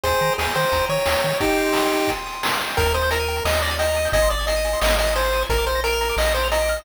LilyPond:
<<
  \new Staff \with { instrumentName = "Lead 1 (square)" } { \time 4/4 \key aes \major \tempo 4 = 176 <aes' c''>4 aes'8 c''4 des''4. | <ees' g'>2~ <ees' g'>8 r4. | \key ees \major bes'8 c''8 bes'4 ees''8 d''8 ees''4 | ees''8 d''8 ees''4 ees''8 ees''8 c''4 |
bes'8 c''8 bes'4 ees''8 c''8 ees''4 | }
  \new Staff \with { instrumentName = "Lead 1 (square)" } { \time 4/4 \key aes \major g''8 bes''8 ees'''8 g''8 bes''8 ees'''8 g''8 bes''8 | g''8 c'''8 ees'''8 g''8 c'''8 ees'''8 g''8 c'''8 | \key ees \major g''16 bes''16 ees'''16 g'''16 bes'''16 ees''''16 g''16 bes''16 ees'''16 g'''16 bes'''16 ees''''16 g''16 bes''16 ees'''16 g'''16 | aes''16 c'''16 ees'''16 aes'''16 c''''16 ees''''16 aes''16 c'''16 ees'''16 aes'''16 c''''16 ees''''16 aes''16 c'''16 ees'''16 aes'''16 |
bes''16 d'''16 f'''16 bes'''16 d''''16 f''''16 bes''16 d'''16 f'''16 bes'''16 d''''16 f''''16 bes''16 d'''16 f'''16 bes'''16 | }
  \new Staff \with { instrumentName = "Synth Bass 1" } { \clef bass \time 4/4 \key aes \major ees,8 ees8 ees,8 ees8 ees,8 ees8 ees,8 ees8 | r1 | \key ees \major ees,2 ees,2 | aes,,2 aes,,2 |
bes,,2 bes,,2 | }
  \new DrumStaff \with { instrumentName = "Drums" } \drummode { \time 4/4 <hh bd>16 hh16 hh16 hh16 sn16 hh16 hh16 hh16 <hh bd>16 hh16 hh16 hh16 sn16 hh16 hh16 hh16 | <hh bd>16 hh16 hh16 hh16 sn16 hh16 hh16 hh16 <hh bd>16 hh16 hh16 hh16 sn16 hh16 hh16 hh16 | <hh bd>16 hh16 hh16 hh16 hh16 hh16 hh16 hh16 sn16 hh16 hh16 hh16 hh16 hh16 hh16 hho16 | <hh bd>16 hh16 hh16 hh16 hh16 hh16 hh16 hh16 sn16 hh16 hh16 hh16 hh16 hh16 hh16 hh16 |
<hh bd>16 hh16 hh16 hh16 hh16 hh16 hh16 hh16 sn16 hh16 hh16 hh16 hh16 hh16 hh16 hh16 | }
>>